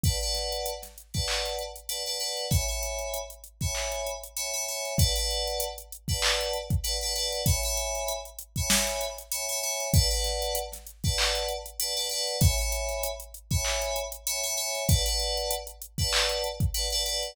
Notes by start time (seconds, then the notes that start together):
0.03 B4 D5 F#5 A5, kick, closed hi-hat
0.21 B4 D5 F#5 A5, closed hi-hat
0.35 snare, closed hi-hat
0.52 closed hi-hat
0.66 closed hi-hat
0.82 snare, closed hi-hat
0.98 closed hi-hat
1.14 B4 D5 F#5 A5, kick, closed hi-hat
1.28 clap
1.46 closed hi-hat
1.59 closed hi-hat
1.76 closed hi-hat
1.89 B4 D5 F#5 A5, closed hi-hat
2.06 B4 D5 F#5 A5, closed hi-hat
2.20 B4 D5 F#5 A5, closed hi-hat
2.37 closed hi-hat
2.51 C#5 E5 G#5 B5, kick, closed hi-hat
2.68 C#5 E5 G#5 B5, closed hi-hat
2.83 closed hi-hat
2.99 closed hi-hat
3.14 closed hi-hat
3.30 closed hi-hat
3.44 closed hi-hat
3.61 C#5 E5 G#5 B5, kick, closed hi-hat
3.75 clap
3.92 closed hi-hat
4.07 closed hi-hat
4.24 closed hi-hat
4.36 C#5 E5 G#5 B5, closed hi-hat
4.53 C#5 E5 G#5 B5, closed hi-hat
4.68 C#5 E5 G#5 B5, closed hi-hat
4.85 closed hi-hat
4.98 B4 D5 F#5 A5, kick, closed hi-hat
5.16 B4 D5 F#5 A5, closed hi-hat
5.31 closed hi-hat
5.47 closed hi-hat
5.60 closed hi-hat
5.78 closed hi-hat
5.92 closed hi-hat
6.08 B4 D5 F#5 A5, kick, closed hi-hat
6.22 clap
6.41 closed hi-hat
6.53 closed hi-hat
6.70 kick, closed hi-hat
6.84 B4 D5 F#5 A5, closed hi-hat
7.01 B4 D5 F#5 A5, closed hi-hat
7.15 B4 D5 F#5 A5, closed hi-hat
7.33 closed hi-hat
7.46 C#5 E5 G#5 B5, kick, closed hi-hat
7.63 C#5 E5 G#5 B5, closed hi-hat
7.77 closed hi-hat
7.95 closed hi-hat
8.09 closed hi-hat
8.25 closed hi-hat
8.39 closed hi-hat
8.56 C#5 E5 G#5 B5, kick, closed hi-hat
8.70 snare
8.87 closed hi-hat
9.01 closed hi-hat
9.18 closed hi-hat
9.32 C#5 E5 G#5 B5, closed hi-hat
9.49 C#5 E5 G#5 B5, closed hi-hat
9.63 C#5 E5 G#5 B5, closed hi-hat
9.80 closed hi-hat
9.94 B4 D5 F#5 A5, kick, closed hi-hat
10.10 B4 D5 F#5 A5, closed hi-hat
10.24 snare, closed hi-hat
10.42 closed hi-hat
10.55 closed hi-hat
10.72 snare, closed hi-hat
10.87 closed hi-hat
11.04 B4 D5 F#5 A5, kick, closed hi-hat
11.18 clap
11.35 closed hi-hat
11.49 closed hi-hat
11.66 closed hi-hat
11.80 B4 D5 F#5 A5, closed hi-hat
11.97 B4 D5 F#5 A5, closed hi-hat
12.09 B4 D5 F#5 A5, closed hi-hat
12.27 closed hi-hat
12.41 C#5 E5 G#5 B5, kick, closed hi-hat
12.58 C#5 E5 G#5 B5, closed hi-hat
12.72 closed hi-hat
12.89 closed hi-hat
13.03 closed hi-hat
13.20 closed hi-hat
13.34 closed hi-hat
13.51 C#5 E5 G#5 B5, kick, closed hi-hat
13.65 clap
13.82 closed hi-hat
13.96 closed hi-hat
14.12 closed hi-hat
14.27 C#5 E5 G#5 B5, closed hi-hat
14.43 C#5 E5 G#5 B5, closed hi-hat
14.57 C#5 E5 G#5 B5, closed hi-hat
14.75 closed hi-hat
14.88 B4 D5 F#5 A5, kick, closed hi-hat
15.06 B4 D5 F#5 A5, closed hi-hat
15.20 closed hi-hat
15.37 closed hi-hat
15.51 closed hi-hat
15.67 closed hi-hat
15.82 closed hi-hat
15.98 B4 D5 F#5 A5, kick, closed hi-hat
16.13 clap
16.29 closed hi-hat
16.44 closed hi-hat
16.60 kick, closed hi-hat
16.74 B4 D5 F#5 A5, closed hi-hat
16.90 B4 D5 F#5 A5, closed hi-hat
17.05 B4 D5 F#5 A5, closed hi-hat
17.23 closed hi-hat